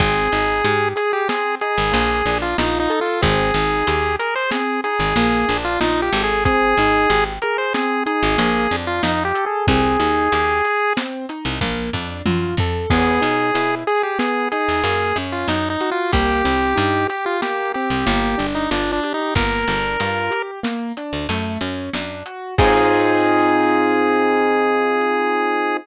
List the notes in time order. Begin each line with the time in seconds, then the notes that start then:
0.00 G#1 C4 G#4, kick, closed hi-hat
0.32 G#1 D#4, closed hi-hat
0.65 G#2 G4, closed hi-hat
0.96 G#4, closed hi-hat
1.13 G4
1.28 C4 G#4, snare
1.61 D#4 G#4, closed hi-hat
1.78 G#1
1.92 A#1 A#3, closed hi-hat
2.26 A#1 D4, closed hi-hat
2.42 F4
2.58 A#1 D#4 F4, snare
2.80 D#4
2.90 A4, closed hi-hat
3.01 F4
3.22 G#1 C4 G#4, kick, closed hi-hat
3.54 G#1 D#4, closed hi-hat
3.87 D#2 G4, closed hi-hat
4.19 G#4 A#4, closed hi-hat
4.35 C5
4.51 C4 G#4, snare
4.84 D#4 G#4, closed hi-hat
4.99 G#1
5.16 A#1 A#3, closed hi-hat
5.48 A#1 D4, closed hi-hat
5.65 F4
5.81 A#1 D#4 F4, snare
6.02 G4
6.12 G#1 A4, closed hi-hat
6.24 G#4
6.45 C4 G#4, kick, closed hi-hat
6.77 G#1 D#4, closed hi-hat
7.09 G#1 G4, closed hi-hat
7.42 G#4 A#4, closed hi-hat
7.58 C5
7.74 C4 G#4, snare
8.06 D#4 G#4, closed hi-hat
8.23 G#1
8.38 A#1 A#3, closed hi-hat
8.71 F2 D4, closed hi-hat
8.87 F4
9.03 F2 D#4 F4, snare
9.25 G4
9.34 A4, closed hi-hat
9.46 G#4
9.67 C2 C4 G#4, kick, closed hi-hat
9.99 D#2 D#4, closed hi-hat
10.32 D#2 G4, closed hi-hat
10.64 G#4, closed hi-hat
10.97 C4, snare
11.29 D#4, closed hi-hat
11.45 C2
11.61 A#1 A#3, kick, high tom
11.93 F2 D4, floor tom
12.26 F#2 F4, high tom
12.57 F2 A4, floor tom
12.90 E2 B3 G#4, kick, crash
13.21 B2 D#4, closed hi-hat
13.54 B2 E4, closed hi-hat
13.87 G#4, closed hi-hat
14.03 G4
14.19 B3 G#4, snare
14.52 D#4 G#4, closed hi-hat
14.68 E2
14.84 F#2 A#3, closed hi-hat
15.16 F#2 C#4, closed hi-hat
15.32 F4
15.48 F#2 D#4, snare
15.70 D#4
15.81 F#4, closed hi-hat
15.91 F4
16.12 C2 A#3 G4, kick, closed hi-hat
16.44 C2 C4, closed hi-hat
16.76 G2 D#4, closed hi-hat
17.08 G4, closed hi-hat
17.26 F4
17.42 A#3 G4, snare
17.74 C4 G4, closed hi-hat
17.90 C2
18.06 G1 A#3, closed hi-hat
18.38 G1 D4, closed hi-hat
18.55 D#4
18.71 G1 D4 F4, snare
18.92 D4
19.03 G4, closed hi-hat
19.14 D#4
19.35 G1 A#3 A#4, kick, closed hi-hat
19.68 G1 D4, closed hi-hat
20.00 G2 F4, closed hi-hat
20.31 G4, closed hi-hat
20.63 A#3, snare
20.97 D4, closed hi-hat
21.13 D2
21.29 F#2 A3, closed hi-hat
21.61 F#2 C#4, closed hi-hat
21.93 F#2 D4, snare
22.26 F#4, closed hi-hat
22.58 G#2 C4 D#4 F4 G#4, kick, crash